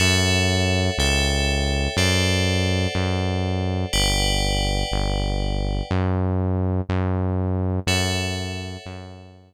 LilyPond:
<<
  \new Staff \with { instrumentName = "Synth Bass 1" } { \clef bass \time 4/4 \key fis \phrygian \tempo 4 = 122 fis,2 cis,2 | fis,2 fis,2 | g,,2 g,,2 | fis,2 fis,2 |
fis,2 fis,2 | }
  \new Staff \with { instrumentName = "Tubular Bells" } { \time 4/4 \key fis \phrygian <a' cis'' e'' fis''>2 <a' cis'' e'' g''>2 | <a' c'' d'' fis''>1 | <b' d'' fis'' g''>1 | r1 |
<a' cis'' e'' fis''>1 | }
>>